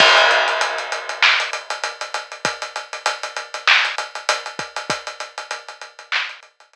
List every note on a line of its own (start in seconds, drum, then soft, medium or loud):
0.00 kick loud
0.00 crash loud
0.17 closed hi-hat medium
0.31 closed hi-hat medium
0.48 closed hi-hat medium
0.61 closed hi-hat loud
0.78 closed hi-hat medium
0.92 closed hi-hat medium
1.09 closed hi-hat medium
1.22 clap loud
1.40 closed hi-hat medium
1.53 closed hi-hat loud
1.70 closed hi-hat medium
1.84 closed hi-hat loud
2.01 closed hi-hat medium
2.14 closed hi-hat medium
2.32 closed hi-hat medium
2.45 kick loud
2.45 closed hi-hat loud
2.62 closed hi-hat medium
2.76 closed hi-hat medium
2.93 closed hi-hat medium
3.06 closed hi-hat loud
3.23 closed hi-hat medium
3.36 closed hi-hat medium
3.54 closed hi-hat medium
3.67 clap loud
3.85 closed hi-hat medium
3.98 closed hi-hat loud
4.15 closed hi-hat medium
4.29 closed hi-hat loud
4.46 closed hi-hat medium
4.59 kick loud
4.59 closed hi-hat medium
4.76 closed hi-hat medium
4.90 kick loud
4.90 closed hi-hat loud
5.07 closed hi-hat medium
5.20 closed hi-hat medium
5.38 closed hi-hat medium
5.51 closed hi-hat loud
5.68 closed hi-hat medium
5.81 closed hi-hat medium
5.99 closed hi-hat medium
6.12 clap loud
6.29 closed hi-hat medium
6.43 closed hi-hat medium
6.60 closed hi-hat medium
6.73 closed hi-hat loud